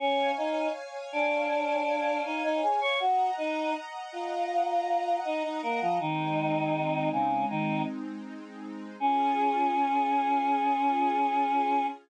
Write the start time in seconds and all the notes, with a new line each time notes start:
0.00 C#4 C#5 F5 G#5
0.37 D#4 D#5
1.12 D4 D5
2.25 D#4 D#5
2.44 D#4 D#5
2.62 G#4 G#5
2.81 C#5 C#6
3.00 F#4 D#5 F#5 A#5
3.38 D#4 D#5
4.12 F4 F5
5.25 D#4 D#5
5.44 D#4 D#5
5.62 A#3 A#4
5.81 F3 F4
5.99 D#3 G#3 C4 D#4
7.12 C#3 C#4
7.50 D#3 D#4
9.00 C#4 F4 G#4